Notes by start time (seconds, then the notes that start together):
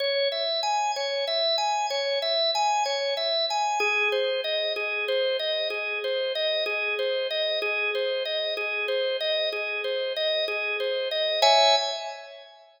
0.00 C#5
0.32 E5
0.63 G#5
0.96 C#5
1.28 E5
1.58 G#5
1.90 C#5
2.22 E5
2.55 G#5
2.86 C#5
3.17 E5
3.50 G#5
3.80 G#4
4.12 C5
4.44 D#5
4.76 G#4
5.08 C5
5.39 D#5
5.70 G#4
6.04 C5
6.35 D#5
6.66 G#4
6.99 C5
7.31 D#5
7.62 G#4
7.95 C5
8.25 D#5
8.57 G#4
8.88 C5
9.21 D#5
9.53 G#4
9.84 C5
10.16 D#5
10.48 G#4
10.80 C5
11.11 D#5
11.42 C#5 E5 G#5